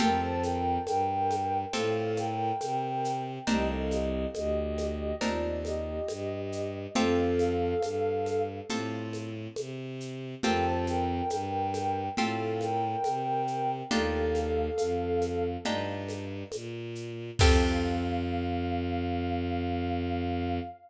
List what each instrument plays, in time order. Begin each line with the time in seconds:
0.00 violin F2, acoustic guitar (steel) C4 F4 G4 A4, ocarina A#4 G5, low conga, shaker
0.22 ocarina C5 A5
0.43 ocarina A#4 G5, high conga, shaker
0.87 violin G2, ocarina A#4 G5, high conga, shaker
1.31 high conga, shaker
1.73 violin A2, acoustic guitar (steel) C4 F4 G4 A4, ocarina A4 F5, low conga, shaker
2.17 ocarina A#4 G5, high conga, shaker
2.61 violin C3, high conga, shaker
3.05 shaker
3.47 violin C2, acoustic guitar (steel) C4 D4 D#4 A#4, ocarina G4 D#5, low conga, shaker
3.70 ocarina A4 F5
3.91 ocarina G4 D#5, high conga, shaker
4.34 violin D2, ocarina G4 D#5, high conga, shaker
4.78 high conga, shaker
5.21 violin D#2, acoustic guitar (steel) C4 D4 D#4 A#4, ocarina F4 D5, low conga, shaker
5.65 ocarina G4 D#5, high conga, shaker
6.09 violin G2, high conga, shaker
6.52 shaker
6.95 violin F2, acoustic guitar (steel) C4 F4 G4 A4, ocarina A4 F5, low conga, shaker
7.39 high conga, shaker
7.82 violin G2, high conga, shaker
8.26 high conga, shaker
8.69 violin A2, acoustic guitar (steel) C4 F4 G4 A4, low conga, shaker
9.13 high conga, shaker
9.56 violin C3, high conga, shaker
10.00 shaker
10.43 violin F2, acoustic guitar (steel) C4 F4 G4 A4, ocarina A#4 G5, low conga, shaker
10.65 ocarina C5 A5
10.87 ocarina A#4 G5, high conga, shaker
11.30 violin G2, ocarina A#4 G5, high conga, shaker
11.74 high conga, shaker
12.17 violin A2, acoustic guitar (steel) C4 F4 G4 A4, ocarina A4 F5, low conga, shaker
12.61 ocarina A#4 G5, high conga, shaker
13.04 violin C3, high conga, shaker
13.47 shaker
13.91 violin D#2, acoustic guitar (steel) D4 D#4 F4 G4, ocarina A4 F5, low conga, shaker
14.35 high conga, shaker
14.78 violin F2, high conga, shaker
15.22 high conga, shaker
15.65 violin G2, acoustic guitar (steel) D4 D#4 F4 G4, low conga, shaker
16.09 high conga, shaker
16.52 violin A#2, high conga, shaker
16.95 shaker
17.39 violin F2, acoustic guitar (steel) C4 F4 G4 A4, ocarina F5, kick, crash